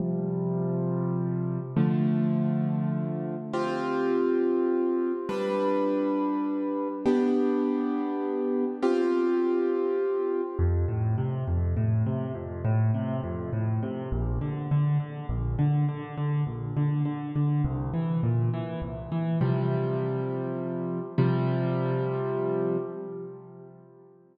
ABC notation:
X:1
M:6/8
L:1/8
Q:3/8=68
K:C
V:1 name="Acoustic Grand Piano"
[C,F,G,]6 | [D,F,A,]6 | [CFG]6 | [G,DB]6 |
[B,DG]6 | [CFG]6 | [K:F] F,, A,, C, F,, A,, C, | F,, A,, C, F,, A,, C, |
B,,, D, D, D, B,,, D, | D, D, B,,, D, D, D, | C,, E, B,, E, C,, E, | [K:C] [C,F,G,]6 |
[C,F,G,]6 |]